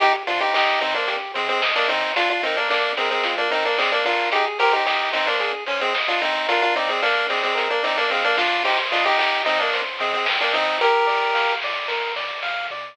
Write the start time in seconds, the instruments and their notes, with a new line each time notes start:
0.00 synth bass 1 C2, lead 1 (square) D#4 G4, kick, closed hi-hat
0.27 synth bass 1 C3, lead 1 (square) D4 F4 C5, open hi-hat
0.40 lead 1 (square) D#4 G4
0.53 synth bass 1 C2, lead 1 (square) D#4 G4 D#5, kick, snare
0.81 synth bass 1 C3, lead 1 (square) C4 D#4 C5, open hi-hat
0.94 lead 1 (square) A#3 D4
1.08 synth bass 1 C2, lead 1 (square) G4, kick, closed hi-hat
1.34 synth bass 1 C3, lead 1 (square) G#3 C4 C5, open hi-hat
1.49 lead 1 (square) G#3 C4
1.62 synth bass 1 C2, lead 1 (square) D#5, kick, snare
1.75 lead 1 (square) A#3 D4
1.89 synth bass 1 C3, lead 1 (square) C4 D#4 C5, open hi-hat
2.16 synth bass 1 A#1, lead 1 (square) D4 F4, kick, closed hi-hat
2.30 lead 1 (square) D4 F4
2.43 synth bass 1 A#2, lead 1 (square) C4 D#4 A#4, open hi-hat
2.57 lead 1 (square) A#3 D4
2.70 synth bass 1 A#1, lead 1 (square) A#3 D4 D5, kick, clap
2.97 synth bass 1 A#2, lead 1 (square) G#3 C4 A#4, open hi-hat
3.11 lead 1 (square) G#3 C4
3.23 synth bass 1 A#1, lead 1 (square) F4, kick, closed hi-hat
3.38 lead 1 (square) A#3 D4
3.51 synth bass 1 A#2, lead 1 (square) C4 D#4 A#4, open hi-hat
3.65 lead 1 (square) A#3 D4
3.78 synth bass 1 A#1, lead 1 (square) G#3 C4 D5, kick, clap
3.92 lead 1 (square) A#3 D4
4.05 synth bass 1 A#2, lead 1 (square) D4 F4 A#4, open hi-hat
4.32 synth bass 1 G#1, lead 1 (square) D#4 G4 G#4, kick, closed hi-hat
4.59 synth bass 1 G#2, lead 1 (square) G4 A#4 C5, open hi-hat
4.73 lead 1 (square) D#4 G4
4.85 synth bass 1 G#1, lead 1 (square) D#4 G4 D#5, kick, snare
5.13 synth bass 1 G#2, lead 1 (square) C4 D#4 C5, open hi-hat
5.27 lead 1 (square) A#3 D4
5.40 synth bass 1 G#1, lead 1 (square) G#4, kick, closed hi-hat
5.66 synth bass 1 G#2, lead 1 (square) C#4 C5, open hi-hat
5.81 lead 1 (square) G#3 C4
5.93 synth bass 1 G#1, lead 1 (square) D#5, kick, snare
6.08 lead 1 (square) D4 F4
6.21 synth bass 1 G#2, lead 1 (square) C4 D#4 C5, open hi-hat
6.48 synth bass 1 A#1, lead 1 (square) D4 F4 A#4, kick, closed hi-hat
6.62 lead 1 (square) D4 F4
6.76 synth bass 1 A#2, lead 1 (square) C4 D#4 D5, open hi-hat
6.89 lead 1 (square) G#3 C4
7.02 synth bass 1 A#1, lead 1 (square) A#3 D4 F5, kick, clap
7.30 synth bass 1 A#2, lead 1 (square) G#3 C4 D5, open hi-hat
7.43 lead 1 (square) G#3 C4
7.55 synth bass 1 A#1, lead 1 (square) A#4, kick, closed hi-hat
7.70 lead 1 (square) A#3 D4
7.83 synth bass 1 A#2, lead 1 (square) C4 D#4 D5, open hi-hat
7.97 lead 1 (square) A#3 D4
8.10 synth bass 1 A#2, lead 1 (square) G#3 C4 F5, kick, snare
8.24 lead 1 (square) A#3 D4
8.38 synth bass 1 B2, lead 1 (square) D4 F4 D5, snare
8.65 synth bass 1 C2, lead 1 (square) D#4 G4 C5, kick, crash
8.92 synth bass 1 C3, lead 1 (square) D4 F4 D#5, open hi-hat
9.06 lead 1 (square) D#4 G4
9.17 synth bass 1 C2, lead 1 (square) D#4 G4 G5, kick, clap
9.45 synth bass 1 C3, lead 1 (square) C4 D#4 D#5, open hi-hat
9.60 lead 1 (square) A#3 D4
9.73 synth bass 1 C2, lead 1 (square) C5, kick, closed hi-hat
9.99 synth bass 1 C3, lead 1 (square) G#3 C4 D#5, open hi-hat
10.14 lead 1 (square) G#3 C4
10.26 synth bass 1 C2, lead 1 (square) G5, kick, snare
10.41 lead 1 (square) A#3 D4
10.53 synth bass 1 C3, lead 1 (square) C4 D#4 D#5, open hi-hat
10.80 synth bass 1 A#1, lead 1 (square) G4 A#4, kick, closed hi-hat
11.07 synth bass 1 A#2, lead 1 (square) D5, open hi-hat
11.34 synth bass 1 A#1, lead 1 (square) F5, kick, snare
11.62 synth bass 1 A#2, lead 1 (square) D5, open hi-hat
11.88 synth bass 1 A#1, lead 1 (square) A#4, kick, snare
12.16 synth bass 1 A#2, lead 1 (square) D5, snare
12.43 synth bass 1 A#2, lead 1 (square) F5, snare
12.70 synth bass 1 B2, lead 1 (square) D5